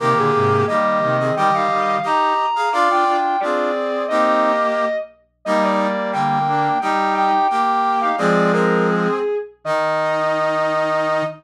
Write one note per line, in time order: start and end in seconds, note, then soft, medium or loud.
0.00 0.14 C3 medium
0.00 0.14 D#3 medium
0.00 0.65 A#3 medium
0.00 0.65 G4 loud
0.00 0.16 A#4 medium
0.17 0.32 A#2 medium
0.17 0.32 D3 medium
0.17 0.62 G#4 medium
0.34 0.64 G#2 medium
0.34 0.64 C3 medium
0.67 1.00 D#3 medium
0.67 1.00 G3 medium
0.67 1.16 A#3 medium
0.67 1.16 G4 medium
0.67 1.33 D#5 medium
1.02 1.31 C3 medium
1.02 1.31 D#3 medium
1.20 1.35 C4 medium
1.20 1.35 G#4 medium
1.36 1.50 D#3 medium
1.36 1.50 G3 medium
1.36 1.96 G4 medium
1.36 1.96 D#5 medium
1.36 1.52 G5 medium
1.54 1.68 D#3 medium
1.54 1.68 G3 medium
1.54 2.04 F5 medium
1.70 1.98 D#3 medium
1.70 1.98 G3 medium
2.03 2.34 D#4 medium
2.03 2.46 G4 medium
2.03 2.34 G4 medium
2.03 2.46 D#5 medium
2.03 2.71 A#5 medium
2.56 2.69 G#4 medium
2.56 2.69 F5 medium
2.72 2.89 D4 medium
2.72 3.17 F4 medium
2.72 2.89 F4 medium
2.72 3.17 D5 loud
2.72 2.86 F5 loud
2.90 3.04 D4 medium
2.90 3.04 F4 medium
2.90 3.40 G5 medium
3.07 3.37 D4 medium
3.07 3.37 F4 medium
3.40 4.05 C4 medium
3.40 3.72 D4 medium
3.40 3.72 F4 medium
3.40 4.05 G#4 medium
3.40 4.04 D5 medium
4.08 4.85 A#3 medium
4.08 4.52 C4 medium
4.08 4.52 D#4 medium
4.08 4.85 G4 medium
4.08 4.96 D#5 medium
5.45 6.39 G3 medium
5.45 5.87 G3 medium
5.45 6.39 A#3 medium
5.45 5.87 D#4 loud
5.45 5.61 D#5 medium
5.63 6.10 D5 medium
6.12 6.69 D3 medium
6.12 6.69 A#3 medium
6.12 6.78 G5 medium
6.48 6.78 A#3 medium
6.48 6.78 D4 medium
6.81 7.31 G3 medium
6.81 7.31 D#4 medium
6.81 7.48 D#4 medium
6.81 7.48 G4 medium
6.81 7.12 G5 medium
7.14 7.46 G5 medium
7.50 8.09 A#3 medium
7.50 8.09 G4 medium
7.50 7.97 G5 medium
8.01 8.16 D#4 medium
8.01 8.16 G4 medium
8.01 8.16 F5 medium
8.18 9.08 F3 medium
8.18 9.08 G#3 loud
8.18 8.52 C4 medium
8.18 8.52 G#4 loud
8.18 8.51 D5 medium
8.52 9.19 C4 medium
8.52 9.19 G#4 medium
8.52 8.84 A#4 medium
8.89 9.35 G#4 medium
9.64 11.22 D#3 loud
9.64 11.24 D#4 loud
9.64 11.23 D#5 loud